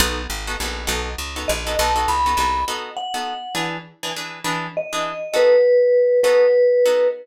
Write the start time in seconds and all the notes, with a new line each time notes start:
0.00 B1 B3 D#4 F#4 A4
0.30 G#1
0.47 B3 D#4 F#4 A4
0.60 A#1 B3 D#4 F#4 A4
0.87 B1 B3 D#4 F#4 A4
1.18 C#2
1.36 B3 D#4 F#4 A4
1.48 A#1 D#5
1.67 B3 D#4 F#4 A4
1.79 B1 B3 D#4 F#4 A4 A5
1.96 B3 D#4 F#4 A4
2.08 C#2 B5
2.26 B3 D#4 F#4 A4
2.37 C2 B3 D#4 F#4 A4
2.68 B3 D#4 F#4 A4
2.97 F#5
3.14 B3 D#4 F#4 A4
3.55 E3 D4 G#4 B4
4.03 E3 D4 G#4 B4
4.16 E3 D4 G#4 B4
4.44 E3 D4 G#4 B4
4.77 D#5
4.93 E3 D4 G#4 B4
5.34 B3 D#4 F#4 A4 B4
6.23 B3 D#4 F#4 A4 B4
6.86 B3 D#4 F#4 A4